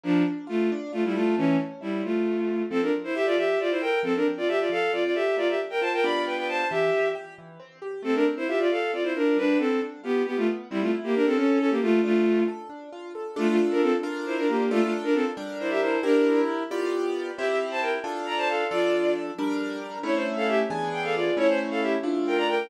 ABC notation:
X:1
M:6/8
L:1/16
Q:3/8=90
K:Dm
V:1 name="Violin"
[F,D]2 z2 [A,F]2 z2 [A,F] [G,E] [A,F]2 | [E,^C]2 z2 [G,E]2 [A,F]6 | [K:F] [CA] [DB] z [Ec] [Ge] [Fd] [Ge]2 [Fd] [Ec] [Bg]2 | [CA] [DB] z [Fd] [Ge] [Fd] [Af]2 [Fd] [Fd] [Ge]2 |
[Fd] [Ge] z [Bg] [ca] [Bg] [d=b]2 [=Bg] [Bg] [ca]2 | [Ge]4 z8 | [CA] [DB] z [Ec] [Ge] [Fd] [Af]2 [Fd] [Ec] [DB]2 | [D=B]2 [CA]2 z2 [=B,G]2 [B,G] [A,F] z2 |
[G,E] [A,F] z [B,G] [DB] [CA] [^CA]2 [CA] [B,G] [A,F]2 | [A,F]4 z8 | [K:Dm] [A,F] [A,F] z [DB] [CA] z3 [Ec] [DB] [B,G]2 | [A,F] [A,F] z [DB] [CA] z3 [Ec] [Ge] [Ec]2 |
[DB]4 z8 | [Ge] [Ge] z [ca] [Bg] z3 [db] [ca] [Af]2 | [Fd]4 z8 | [E^c] =c z [Af] [Ge] z3 g [Af] [Fd]2 |
[E^c] =c z [Af] [Ge] z3 [Bg] [db] [Bg]2 |]
V:2 name="Acoustic Grand Piano"
B,2 D2 F2 D2 F2 A2 | A,2 ^C2 E2 F,2 A,2 =C2 | [K:F] F,2 C2 A2 F,2 C2 A2 | F,2 C2 A2 F,2 C2 A2 |
B,2 D2 F2 [G,=B,DF]6 | E,2 C2 G2 E,2 C2 G2 | A,2 C2 F2 A,2 C2 F2 | G,2 =B,2 D2 F2 G,2 B,2 |
C2 E2 G2 ^C2 E2 A2 | D2 F2 A2 D2 F2 A2 | [K:Dm] [DFA]6 [DFB]6 | [DFA]6 [G,DB]6 |
[EGB]6 [=B,FGd]6 | [CEG]6 [DFA]6 | [F,DA]6 [G,DB]6 | [A,^CE]6 [E,=B,D^G]6 |
[A,^CE]6 [A,DF]6 |]